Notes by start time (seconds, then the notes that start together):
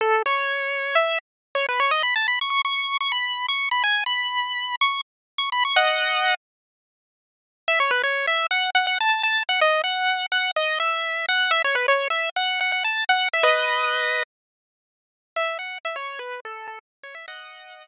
0.01 A4
0.26 C#5
0.95 E5
1.55 C#5
1.69 B4
1.80 C#5
1.91 D#5
2.03 B5
2.16 A5
2.28 B5
2.41 C#6
2.50 C#6
2.65 C#6
3.01 C#6
3.12 B5
3.48 C#6
3.71 B5
3.84 G#5
4.06 B5
4.81 C#6
5.38 C#6
5.52 B5
5.65 C#6
5.76 D#5 F#5
7.68 E5
7.80 C#5
7.91 B4
8.03 C#5
8.27 E5
8.51 F#5
8.75 F#5
8.87 F#5
9.01 A5
9.23 A5
9.49 F#5
9.61 D#5
9.84 F#5
10.32 F#5
10.56 D#5
10.80 E5
11.29 F#5
11.51 E5
11.64 C#5
11.75 B4
11.88 C#5
12.10 E5
12.36 F#5
12.61 F#5
12.72 F#5
12.84 A5
13.09 F#5
13.33 E5
13.43 B4 D#5
15.36 E5
15.59 F#5
15.85 E5
15.96 C#5
16.19 B4
16.45 A4
16.68 A4
17.03 C#5
17.15 E5
17.28 D#5 F#5